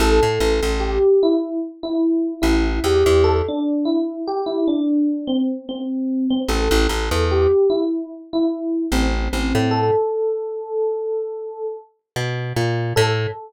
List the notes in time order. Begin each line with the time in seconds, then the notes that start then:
0.00 A1 A4
0.23 A2
0.40 A1
0.63 A1
0.80 G4
1.23 E4
1.83 E4
2.42 A1 E4
2.84 E2 G4
3.06 E2
3.24 A4
3.48 D4
3.85 E4
4.28 G4
4.46 E4
4.68 D4
5.27 C4
5.69 C4
6.30 C4
6.48 A1 A4
6.71 A1
6.89 A1
7.11 E2
7.31 G4
7.70 E4
8.33 E4
8.92 A1 C4
9.33 A1 C4
9.55 A2
9.71 A4
12.16 B2
12.56 A#2
12.96 A2 A4